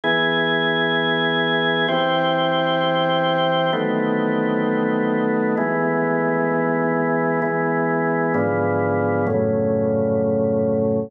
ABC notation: X:1
M:4/4
L:1/8
Q:1/4=65
K:E
V:1 name="Drawbar Organ"
[E,B,G]4 [E,=C=G]4 | [D,F,A,B,]4 [E,G,B,]4 | [E,G,B,]2 [G,,=D,^E,B,]2 [F,,A,,C,]4 |]